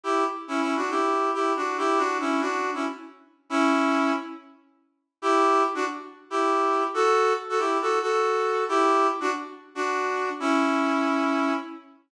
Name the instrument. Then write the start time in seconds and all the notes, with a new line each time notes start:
brass section
0.04 E4 G4
0.48 C#4 E4
0.61 C#4 E4
0.76 D4 F#4
0.90 E4 G4
1.34 E4 G4
1.56 D4 F#4
1.78 E4 G4
1.98 D4 F#4
2.20 C#4 E4
2.41 D4 F#4
2.74 C#4 E4
3.50 C#4 E4
5.22 E4 G4
5.75 D4 F#4
6.30 E4 G4
6.94 F#4 A4
7.49 F#4 A4
7.59 E4 G4
7.81 F#4 A4
8.02 F#4 A4
8.69 E4 G4
9.20 D4 F#4
9.75 D4 F#4
10.40 C#4 E4